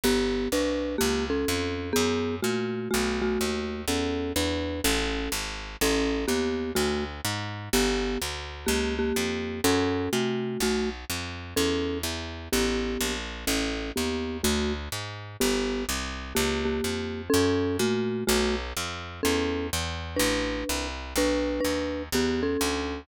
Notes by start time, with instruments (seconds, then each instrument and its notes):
0.04 electric bass (finger) G1, marimba B3 G4
0.52 electric bass (finger) C2, marimba D4 B4
0.98 electric bass (finger) C#2, marimba A#3 G4
1.30 marimba C#4 A4
1.48 electric bass (finger) F2
1.93 electric bass (finger) F#2, marimba B3 G#4
2.43 electric bass (finger) A#2, marimba A3 F#4
2.91 electric bass (finger) B1, marimba A3 F#4
3.22 marimba A3 F#4
3.41 electric bass (finger) D#2
3.88 electric bass (finger) E2, marimba C#4 A4
4.36 electric bass (finger) E2, marimba D4 B4
4.84 electric bass (finger) A1, marimba C#4 A4
5.32 electric bass (finger) G#1
5.81 electric bass (finger) A1, marimba C#4 A4
6.28 electric bass (finger) D#2, marimba B3 G4
6.75 electric bass (finger) D2, marimba A3 F#4
7.25 electric bass (finger) G#2
7.73 electric bass (finger) G1, marimba B3 G4
8.21 electric bass (finger) D2
8.66 electric bass (finger) C#2, marimba A#3 G4
8.99 marimba A#3 G4
9.16 electric bass (finger) F2
9.64 electric bass (finger) F#2, marimba C#4 A4
10.13 electric bass (finger) C3, marimba A3 F#4
10.60 electric bass (finger) B1, marimba A3 F#4
11.10 electric bass (finger) F2
11.56 electric bass (finger) E2, marimba C#4 A4
12.03 electric bass (finger) E2
12.53 electric bass (finger) A1, marimba B3 G4
13.01 electric bass (finger) A#1
13.47 electric bass (finger) A1, marimba C#4 A4
13.96 electric bass (finger) D#2, marimba B3 G4
14.43 electric bass (finger) D2, marimba A3 F#4
14.92 electric bass (finger) G#2
15.40 electric bass (finger) G1, marimba B3 G4
15.89 electric bass (finger) C2
16.35 electric bass (finger) C#2, marimba A#3 G4
16.65 marimba A#3 G4
16.84 electric bass (finger) F2
17.30 marimba C#4 A4
17.34 electric bass (finger) F#2
17.79 electric bass (finger) A#2, marimba A3 F#4
18.27 electric bass (finger) B1, marimba A3 F#4
18.77 electric bass (finger) F2
19.23 electric bass (finger) E2, marimba C#4 A4
19.73 electric bass (finger) E2
20.16 electric bass (finger) A1, marimba D4 B4
20.69 electric bass (finger) C2
21.16 electric bass (finger) B1, marimba D4 B4
21.60 marimba D4 B4
21.64 electric bass (finger) D#2
22.12 electric bass (finger) E2, marimba B3 G4
22.43 marimba C#4 A4
22.61 electric bass (finger) D2